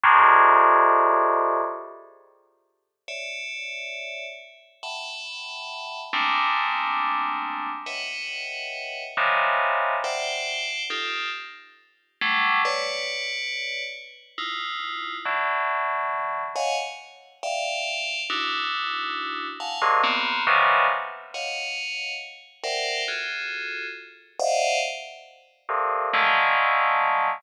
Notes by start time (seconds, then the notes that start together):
0.03 F2 G2 G#2 A2
3.08 C#5 D5 E5
4.83 E5 F#5 G5 A5 B5
6.13 G3 G#3 A3 A#3 C4 D4
7.86 B4 C#5 D#5 E5 F#5 G5
9.17 C3 C#3 D#3 E3 F3
10.04 C5 D5 E5 F#5 G5
10.90 D#4 F4 G4 A4
12.21 F#3 G3 A3
12.65 B4 C#5 D5
14.38 D#4 E4 F4
15.25 D3 E3 F#3
16.55 C#5 D#5 F5 F#5 G#5
17.43 D5 E5 F5 G5
18.30 D4 D#4 E4 F#4
19.60 F5 F#5 G#5 A5
19.82 G2 G#2 A#2 C3
20.03 A#3 B3 C4
20.47 B2 C3 C#3 D#3 E3 F3
21.34 C#5 D#5 F5 F#5
22.63 A#4 C5 D5 E5 F#5 G5
23.08 F4 F#4 G#4 A4
24.39 C5 D5 D#5 E5 F5 F#5
25.69 G2 A2 A#2 C3
26.13 D3 D#3 F3 F#3 G#3 A3